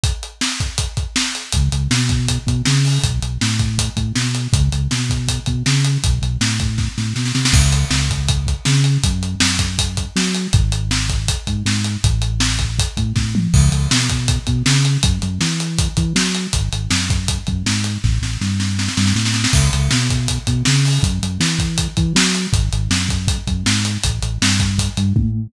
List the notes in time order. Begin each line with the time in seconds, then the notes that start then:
0.04 kick, closed hi-hat
0.23 closed hi-hat
0.41 snare
0.60 kick, closed hi-hat
0.78 kick, closed hi-hat
0.97 kick, closed hi-hat
1.16 snare
1.35 closed hi-hat
1.52 C#2, kick, closed hi-hat
1.72 C#2, closed hi-hat
1.91 B2, snare
2.09 kick, closed hi-hat
2.28 kick, closed hi-hat
2.46 B2, kick, closed hi-hat
2.65 C#3, snare
2.85 open hi-hat
3.03 B1, kick, closed hi-hat
3.22 B1, closed hi-hat
3.41 A2, snare
3.59 kick, closed hi-hat
3.78 kick, closed hi-hat
3.96 A2, kick, closed hi-hat
4.15 B2, snare
4.35 closed hi-hat
4.53 C#2, kick, closed hi-hat
4.72 C#2, closed hi-hat
4.91 B2, snare
5.10 kick, closed hi-hat
5.28 kick, closed hi-hat
5.46 B2, kick, closed hi-hat
5.66 C#3, snare
5.85 closed hi-hat
6.03 B1, kick, closed hi-hat
6.22 B1, closed hi-hat
6.41 A2, snare
6.60 kick, closed hi-hat
6.78 kick, snare
6.98 A2, snare
7.16 B2, snare
7.25 snare
7.35 C3, snare
7.45 snare
7.53 C#2, kick, crash
7.73 closed hi-hat
7.90 C#2, snare
8.10 kick, closed hi-hat
8.29 kick, closed hi-hat
8.47 kick, closed hi-hat
8.65 C#3, snare
8.84 closed hi-hat
9.04 F#2, kick, closed hi-hat
9.23 closed hi-hat
9.40 F#2, snare
9.59 kick, closed hi-hat
9.79 kick, closed hi-hat
9.97 kick, closed hi-hat
10.16 F#3, snare
10.35 closed hi-hat
10.53 G#1, kick, closed hi-hat
10.72 closed hi-hat
10.91 snare
11.09 kick, closed hi-hat
11.28 kick, closed hi-hat
11.47 G#2, kick, closed hi-hat
11.65 G#2, snare
11.84 closed hi-hat
12.04 A1, kick, closed hi-hat
12.22 closed hi-hat
12.40 snare
12.59 kick, closed hi-hat
12.79 kick, closed hi-hat
12.97 A2, kick, closed hi-hat
13.16 A2, kick, snare
13.35 mid tom
13.53 C#2, kick, crash
13.72 C#2, closed hi-hat
13.91 B2, snare
14.10 kick, closed hi-hat
14.28 kick, closed hi-hat
14.47 B2, kick, closed hi-hat
14.66 C#3, snare
14.85 closed hi-hat
15.03 F#2, kick, closed hi-hat
15.22 F#2, closed hi-hat
15.41 E3, snare
15.60 closed hi-hat
15.79 kick, closed hi-hat
15.97 E3, kick, closed hi-hat
16.15 F#3, snare
16.35 closed hi-hat
16.53 G#1, kick, closed hi-hat
16.73 G#1, closed hi-hat
16.90 F#2, snare
17.10 kick, closed hi-hat
17.28 kick, closed hi-hat
17.47 F#2, kick, closed hi-hat
17.66 G#2, snare
17.84 closed hi-hat
18.04 A1, kick, snare
18.22 A1, snare
18.41 G2, snare
18.60 snare
18.79 snare
18.88 snare
18.97 G2, snare
19.07 snare
19.15 A2, snare
19.25 snare
19.34 snare
19.44 snare
19.53 C#2, kick, crash
19.73 C#2, closed hi-hat
19.91 B2, snare
20.10 kick, closed hi-hat
20.28 kick, closed hi-hat
20.47 B2, kick, closed hi-hat
20.65 C#3, snare
20.85 open hi-hat
21.03 F#2, kick, closed hi-hat
21.22 F#2, closed hi-hat
21.40 E3, snare, closed hi-hat
21.59 kick, closed hi-hat
21.78 kick, closed hi-hat
21.97 E3, kick, closed hi-hat
22.15 F#3, snare
22.35 closed hi-hat
22.53 G#1, kick, closed hi-hat
22.73 G#1, closed hi-hat
22.90 F#2, snare
23.09 kick, closed hi-hat
23.28 kick, closed hi-hat
23.47 F#2, kick, closed hi-hat
23.66 G#2, snare
23.85 closed hi-hat
24.04 A1, kick, closed hi-hat
24.22 A1, closed hi-hat
24.42 G2, snare
24.60 kick, closed hi-hat
24.78 kick, closed hi-hat
24.97 G2, closed hi-hat
25.16 A2, kick, high tom